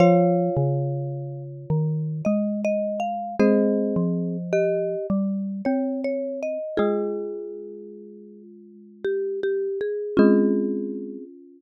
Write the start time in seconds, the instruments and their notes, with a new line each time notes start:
0.00 xylophone F3, marimba F4 C#5 F5
0.57 xylophone C#3
1.70 xylophone D#3
2.25 xylophone G#3, marimba D#5
2.65 marimba D#5
3.00 marimba F5
3.39 xylophone G#3, marimba C4 G#4 C5 D#5
3.96 xylophone F3
4.53 marimba G4 D#5
5.10 xylophone G3
5.65 xylophone C4, marimba C#5
6.04 marimba C#5
6.42 marimba D#5
6.77 marimba G#3 F4 G#4, xylophone G#3
9.04 marimba G4
9.43 marimba G4
9.81 marimba G#4
10.17 xylophone G#3, marimba C4 C#4 F4 G#4